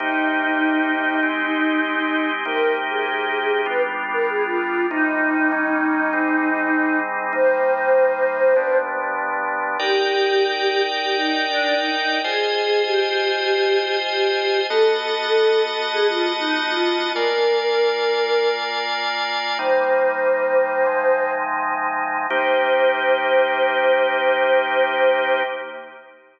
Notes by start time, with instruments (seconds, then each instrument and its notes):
0.00 drawbar organ C3 A#3 D#4 G4, choir aahs D#4
1.23 drawbar organ G#3 C4 D#4 G4
2.45 drawbar organ C3 A#3 D#4 G4, choir aahs A#4
2.90 choir aahs G#4
3.66 drawbar organ G3 B3 D4 F4, choir aahs B4
4.13 choir aahs A#4
4.29 choir aahs G#4
4.45 choir aahs F4
4.89 drawbar organ C3 G3 A#3 D#4, choir aahs D#4
5.52 drawbar organ D#3 G3 A#3 C#4
6.13 drawbar organ G#2 G3 C4 D#4
7.33 drawbar organ C3 G3 A#3 D#4, choir aahs C5
8.56 drawbar organ G2 F3 B3 D4
9.79 drawbar organ D#4 A#4 D5 G5, choir aahs G4
11.03 choir aahs G4
11.17 choir aahs D#4
11.49 choir aahs D4
11.79 choir aahs D#4
12.24 drawbar organ F4 C5 D#5 G#5, choir aahs G#4
12.86 choir aahs G4
14.08 choir aahs G4
14.69 drawbar organ B3 F#4 D#5 A5, choir aahs A4
15.93 choir aahs G#4
16.07 choir aahs F4
16.39 choir aahs D#4
16.68 choir aahs F4
17.14 drawbar organ A#3 F4 D5 G#5, choir aahs A#4
19.59 drawbar organ C3 G3 A#3 D#4, choir aahs C5
20.86 drawbar organ C3 F3 G#3 D#4
22.29 drawbar organ C3 A#3 D#4 G4, choir aahs C5